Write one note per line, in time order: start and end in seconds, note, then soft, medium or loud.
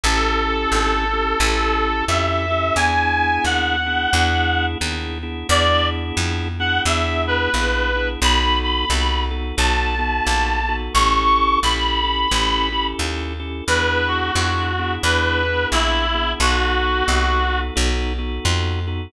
0.04 0.67 A1 medium
0.04 1.05 C#4 medium
0.04 1.05 E4 medium
0.04 1.05 G4 medium
0.04 2.04 A4 loud
0.04 1.05 A4 medium
0.72 1.35 G#1 medium
1.13 1.38 C#4 medium
1.13 1.38 E4 medium
1.13 1.38 G4 medium
1.13 1.38 A4 medium
1.40 2.03 A1 medium
1.40 2.05 C#4 medium
1.40 2.05 E4 medium
1.40 2.05 G4 medium
1.40 2.05 A4 medium
2.08 2.71 F2 medium
2.08 2.46 C#4 medium
2.08 2.46 E4 medium
2.08 2.46 G4 medium
2.08 2.46 A4 medium
2.08 2.75 E5 loud
2.51 2.75 C#4 medium
2.51 2.75 E4 medium
2.51 2.75 G4 medium
2.51 2.75 A4 medium
2.76 3.39 E2 medium
2.76 3.76 B3 medium
2.76 3.76 D4 medium
2.76 3.76 E4 medium
2.76 3.76 G#4 medium
2.76 3.43 G#5 loud
3.45 4.07 D#2 medium
3.45 4.65 F#5 medium
3.86 4.11 B3 medium
3.86 4.11 D4 medium
3.86 4.11 E4 medium
3.86 4.11 G#4 medium
4.13 4.76 E2 medium
4.13 4.78 B3 medium
4.13 4.78 D4 medium
4.13 4.78 E4 medium
4.13 4.78 G#4 medium
4.81 5.44 D#2 medium
4.81 5.18 B3 medium
4.81 5.18 D4 medium
4.81 5.18 E4 medium
4.81 5.18 G#4 medium
5.23 5.48 B3 medium
5.23 5.48 D4 medium
5.23 5.48 E4 medium
5.23 5.48 G#4 medium
5.49 6.12 E2 medium
5.49 6.48 B3 medium
5.49 6.48 D4 medium
5.49 6.48 E4 medium
5.49 6.48 G#4 medium
5.49 5.87 D5 loud
6.17 6.80 F2 medium
6.60 6.84 B3 medium
6.60 6.84 D4 medium
6.60 6.84 E4 medium
6.60 6.84 G#4 medium
6.60 6.81 F#5 loud
6.86 7.48 E2 medium
6.86 7.50 B3 medium
6.86 7.50 D4 medium
6.86 7.50 E4 medium
6.86 7.50 G#4 medium
6.86 7.22 E5 medium
7.27 8.08 B4 loud
7.54 8.17 A#1 medium
7.54 7.92 B3 medium
7.54 7.92 D4 medium
7.54 7.92 E4 medium
7.54 7.92 G#4 medium
7.95 8.20 B3 medium
7.95 8.20 D4 medium
7.95 8.20 E4 medium
7.95 8.20 G#4 medium
8.21 8.85 B1 medium
8.21 8.85 B3 medium
8.21 8.85 D#4 loud
8.21 8.85 F#4 medium
8.21 8.85 A4 medium
8.21 8.57 B5 loud
8.63 9.22 B5 medium
8.90 9.53 C2 medium
8.90 9.30 B3 medium
8.90 9.30 D#4 medium
8.90 9.30 F#4 medium
8.90 9.30 A4 medium
9.31 9.56 B3 medium
9.31 9.56 D#4 medium
9.31 9.56 F#4 medium
9.31 9.56 A4 medium
9.57 10.21 B1 medium
9.57 9.95 B3 medium
9.57 9.95 D#4 medium
9.57 9.95 F#4 medium
9.57 9.95 A4 medium
9.57 10.75 A5 medium
9.99 10.60 B3 medium
9.99 10.60 D#4 medium
9.99 10.60 F#4 medium
9.99 10.60 A4 medium
10.27 10.89 A#1 medium
10.68 10.93 B3 medium
10.68 10.93 D#4 medium
10.68 10.93 F#4 medium
10.68 10.93 A4 medium
10.94 11.58 A1 medium
10.94 11.60 C#4 medium
10.94 11.60 E4 medium
10.94 11.60 G4 medium
10.94 11.60 A4 medium
10.94 11.58 C#6 loud
11.63 12.26 A#1 medium
11.63 12.03 C#4 medium
11.63 12.03 E4 medium
11.63 12.03 G4 medium
11.63 12.03 A4 medium
11.63 12.86 B5 loud
12.04 12.28 C#4 medium
12.04 12.28 E4 medium
12.04 12.28 G4 medium
12.04 12.28 A4 medium
12.31 12.94 A1 medium
12.31 12.69 C#4 medium
12.31 12.69 E4 medium
12.31 12.69 G4 medium
12.31 12.69 A4 medium
12.72 13.34 C#4 medium
12.72 13.34 E4 medium
12.72 13.34 G4 medium
12.72 13.34 A4 medium
12.99 13.62 D#2 medium
13.40 13.64 C#4 medium
13.40 13.64 E4 medium
13.40 13.64 G4 medium
13.40 13.64 A4 medium
13.67 14.31 E2 medium
13.67 14.32 B3 medium
13.67 14.32 D4 medium
13.67 14.32 E4 medium
13.67 14.32 G#4 medium
13.67 14.07 B4 loud
14.08 14.93 F#4 medium
14.35 14.98 F2 medium
14.35 14.73 B3 medium
14.35 14.73 D4 medium
14.35 14.73 E4 medium
14.35 14.73 G#4 medium
14.79 15.04 B3 medium
14.79 15.04 D4 medium
14.79 15.04 E4 medium
14.79 15.04 G#4 medium
15.03 15.66 E2 medium
15.03 15.44 B3 medium
15.03 15.44 D4 medium
15.03 15.44 E4 medium
15.03 15.44 G#4 medium
15.03 15.67 B4 loud
15.45 16.06 B3 medium
15.45 16.06 D4 medium
15.45 16.06 E4 medium
15.45 16.06 G#4 medium
15.72 16.35 A#1 medium
15.72 16.31 E4 loud
16.14 16.39 B3 medium
16.14 16.39 D4 medium
16.14 16.39 E4 medium
16.14 16.39 G#4 medium
16.40 17.03 B1 medium
16.40 17.04 B3 medium
16.40 17.04 D#4 medium
16.40 17.04 F#4 medium
16.40 17.60 F#4 loud
16.40 17.04 A4 medium
17.08 17.71 C2 medium
17.08 17.46 B3 medium
17.08 17.46 D#4 medium
17.08 17.46 F#4 medium
17.08 17.46 A4 medium
17.49 17.74 B3 medium
17.49 17.74 D#4 medium
17.49 17.74 F#4 medium
17.49 17.74 A4 medium
17.76 18.40 B1 medium
17.76 18.13 B3 medium
17.76 18.13 D#4 medium
17.76 18.13 F#4 medium
17.76 18.13 A4 medium
18.18 18.80 B3 medium
18.18 18.80 D#4 medium
18.18 18.80 F#4 medium
18.18 18.80 A4 medium
18.45 19.08 F2 medium
18.87 19.12 B3 medium
18.87 19.12 D#4 medium
18.87 19.12 F#4 medium
18.87 19.12 A4 medium